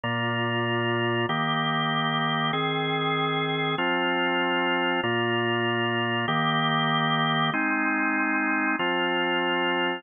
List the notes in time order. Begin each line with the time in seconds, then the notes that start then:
0.04 A#2 A#3 F4
1.29 D#3 A#3 G4
2.53 D#3 C4 G#4
3.78 F3 C4 F4
5.03 A#2 A#3 F4
6.28 D#3 A#3 G4
7.54 G#3 C4 D#4
8.79 F3 C4 F4